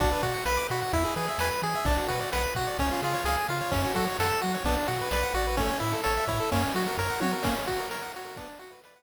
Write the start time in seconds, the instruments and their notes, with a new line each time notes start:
0.00 synth bass 1 B1, lead 1 (square) D4 F#4, kick, crash
0.12 lead 1 (square) B4
0.23 synth bass 1 B2, lead 1 (square) F#4 D5, kick, ride
0.34 lead 1 (square) F#5
0.45 synth bass 1 B1, lead 1 (square) B4 B5, snare
0.57 lead 1 (square) D6
0.69 synth bass 1 B2, lead 1 (square) F#4 B5, ride
0.82 lead 1 (square) F#5
0.93 synth bass 1 E2, lead 1 (square) E4, kick, ride
1.05 lead 1 (square) G#4
1.16 synth bass 1 E3, lead 1 (square) G#4 B4, snare, ride
1.28 lead 1 (square) E5
1.38 synth bass 1 E2, lead 1 (square) B4 G#5, snare
1.51 lead 1 (square) B5
1.62 synth bass 1 E3, lead 1 (square) G#4 G#5, ride
1.75 lead 1 (square) E5
1.85 synth bass 1 B1, lead 1 (square) D4, kick, ride
1.97 lead 1 (square) F#4
2.08 synth bass 1 B2, lead 1 (square) F#4 B4, kick, ride
2.20 lead 1 (square) D5
2.32 synth bass 1 B1, lead 1 (square) B4 F#5, snare
2.43 lead 1 (square) B5
2.55 synth bass 1 B2, lead 1 (square) F#4 F#5, kick, ride
2.67 lead 1 (square) D5
2.78 synth bass 1 C#2, lead 1 (square) C#4, kick, ride
2.91 lead 1 (square) F4
3.01 synth bass 1 C#3, lead 1 (square) F4 G#4, snare, ride
3.14 lead 1 (square) C#5
3.24 synth bass 1 C#2, lead 1 (square) G#4 F5, snare
3.37 lead 1 (square) G#5
3.48 synth bass 1 C#3, lead 1 (square) F4 F5, ride
3.61 lead 1 (square) C#5
3.71 synth bass 1 F#2, lead 1 (square) C#4, kick, ride
3.84 lead 1 (square) F#4
3.94 synth bass 1 F#3, lead 1 (square) F#4 A4, kick, ride
4.07 lead 1 (square) C#5
4.19 synth bass 1 F#2, lead 1 (square) A4 F#5, snare
4.30 lead 1 (square) A5
4.41 synth bass 1 F#3, lead 1 (square) F#4 F#5, ride
4.54 lead 1 (square) C#5
4.64 synth bass 1 B1, lead 1 (square) B3 D4, kick, ride
4.77 lead 1 (square) D4
4.87 synth bass 1 B2, lead 1 (square) F#4, snare, ride
5.01 lead 1 (square) B4
5.11 synth bass 1 B1, lead 1 (square) B4 D5, snare
5.23 lead 1 (square) F#5
5.34 synth bass 1 A1, lead 1 (square) F#4 D5, ride
5.47 lead 1 (square) B4
5.57 lead 1 (square) A3 C#4, kick, ride
5.70 lead 1 (square) C#4
5.80 synth bass 1 A2, lead 1 (square) E4, ride
5.93 lead 1 (square) A4
6.04 synth bass 1 A1, lead 1 (square) A4 C#5, snare
6.17 lead 1 (square) E5
6.27 synth bass 1 A2, lead 1 (square) E4 C#5, kick, ride
6.40 lead 1 (square) A4
6.52 synth bass 1 F#2, lead 1 (square) A#3 C#4, kick, ride
6.63 lead 1 (square) C#4
6.73 synth bass 1 F#3, lead 1 (square) F#4, snare, ride
6.87 lead 1 (square) A#4
6.98 synth bass 1 F#2, lead 1 (square) A#4 C#5, kick
7.10 lead 1 (square) F#5
7.21 synth bass 1 F#3, lead 1 (square) F#4 C#5, high tom
7.32 lead 1 (square) A#4
7.43 lead 1 (square) A#3 C#4, kick, crash
7.56 lead 1 (square) C#4
7.67 lead 1 (square) F#4, kick, ride
7.79 lead 1 (square) A#4
7.91 lead 1 (square) A#4 C#5, snare
8.02 lead 1 (square) F#5
8.13 lead 1 (square) F#4 C#5, ride
8.25 lead 1 (square) A#4
8.36 lead 1 (square) B3 D4, kick, ride
8.49 lead 1 (square) D4
8.59 lead 1 (square) F#4, snare, ride
8.71 lead 1 (square) B4
8.84 lead 1 (square) B4 D5, snare
8.96 lead 1 (square) F#5